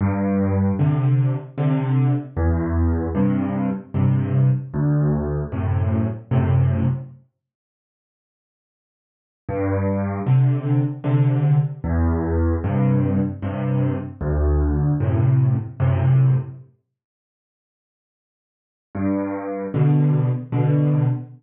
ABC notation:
X:1
M:3/4
L:1/8
Q:1/4=76
K:G
V:1 name="Acoustic Grand Piano" clef=bass
G,,2 [C,D,]2 [C,D,]2 | E,,2 [G,,C,]2 [G,,C,]2 | D,,2 [F,,A,,C,]2 [F,,A,,C,]2 | z6 |
G,,2 [C,D,]2 [C,D,]2 | E,,2 [G,,C,]2 [G,,C,]2 | D,,2 [F,,A,,C,]2 [F,,A,,C,]2 | z6 |
G,,2 [B,,D,]2 [B,,D,]2 | z6 |]